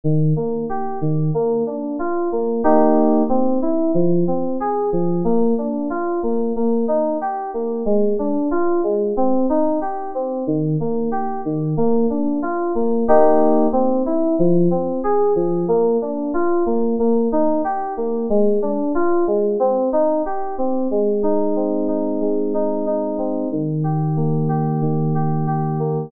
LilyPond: \new Staff { \time 4/4 \key ees \major \tempo 4 = 92 ees8 bes8 g'8 ees8 bes8 d'8 f'8 bes8 | <bes ees' g'>4 c'8 e'8 f8 c'8 aes'8 f8 | bes8 d'8 f'8 bes8 bes8 ees'8 g'8 bes8 | aes8 d'8 f'8 aes8 c'8 ees'8 g'8 c'8 |
ees8 bes8 g'8 ees8 bes8 d'8 f'8 bes8 | <bes ees' g'>4 c'8 e'8 f8 c'8 aes'8 f8 | bes8 d'8 f'8 bes8 bes8 ees'8 g'8 bes8 | aes8 d'8 f'8 aes8 c'8 ees'8 g'8 c'8 |
\key aes \major aes8 ees'8 c'8 ees'8 aes8 ees'8 ees'8 c'8 | ees8 g'8 bes8 g'8 ees8 g'8 g'8 bes8 | }